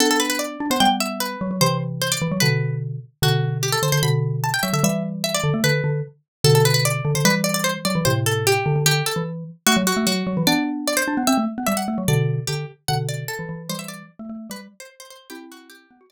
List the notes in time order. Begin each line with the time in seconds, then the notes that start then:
0.00 B3 D4 A4
0.11 A4
0.20 B4
0.30 B4
0.39 D5
0.60 D4
0.70 B3 C5
0.80 G3 B3 G5
1.00 E5
1.20 B4
1.41 F#3
1.51 F#3
1.61 C3 E3 C5
2.02 C5
2.12 D5
2.22 E3
2.32 F#3
2.40 B2 D3 B4
3.22 B2 D3 F#4
3.63 G4
3.72 A4
3.83 D3 C5
3.92 D3 C5
4.03 B2 D3 B5
4.44 A5
4.54 G5
4.63 F#3 E5
4.73 D3 E5
4.83 E3 G3 E5
5.24 E5
5.34 D5
5.44 D3
5.54 A3
5.64 D3 B4
5.84 D3
6.44 B2 D3 A4
6.55 A4
6.65 B4
6.74 B4
6.85 D5
7.05 D3
7.15 D3 C5
7.25 E3 G3 B4
7.44 D5
7.54 D5
7.64 C5
7.85 F#3 D5
7.95 E3
8.05 A2 C3 C5
8.26 A4
8.47 G4
8.66 D3
8.76 D3
8.86 D3 G4
9.06 A4
9.16 E3
9.67 A3 F#4
9.77 F#3
9.87 F#4
9.97 A3
10.07 F#3 F#4
10.27 F#3
10.37 E3
10.47 B3 D4 D5
10.88 D5
10.97 C5
11.08 D4
11.17 B3
11.27 C4 E5
11.38 A3
11.58 B3
11.67 G3 E5
11.77 F#5
11.88 A3
11.98 F#3
12.08 B2 D3 D5
12.47 D3 G4
12.88 B2 D3 F#5
13.09 D5
13.28 A4
13.39 E3
13.49 E3
13.69 E3 G3 C5
13.79 E5
13.88 D5
14.19 A3
14.29 A3
14.50 G3 B4
14.80 C5
15.00 C5
15.10 C5
15.30 C4 E4 G4
15.52 F#4
15.70 G4
15.91 B3
16.01 F#4
16.10 D4 D5